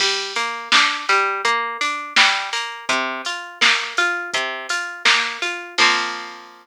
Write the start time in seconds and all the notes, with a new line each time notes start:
0.00 G3, kick, crash
0.36 A#3, open hi-hat
0.72 D4, kick, snare
1.09 G3, open hi-hat
1.45 A#3, kick, closed hi-hat
1.81 D4, open hi-hat
2.16 G3, kick, snare
2.53 A#3, open hi-hat
2.89 C3, kick, closed hi-hat
3.25 F4, open hi-hat
3.61 A#3, kick, snare
3.97 F4, open hi-hat
4.34 C3, kick, closed hi-hat
4.69 F4, open hi-hat
5.05 A#3, kick, snare
5.42 F4, open hi-hat
5.78 F3 A#3 C4, kick, crash